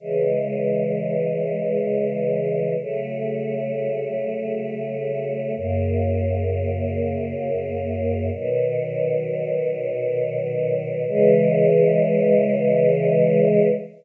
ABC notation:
X:1
M:3/4
L:1/8
Q:1/4=65
K:C#m
V:1 name="Choir Aahs"
[C,E,G,]6 | [C,F,A,]6 | [F,,C,^A,]6 | [B,,D,F,]6 |
[C,E,G,]6 |]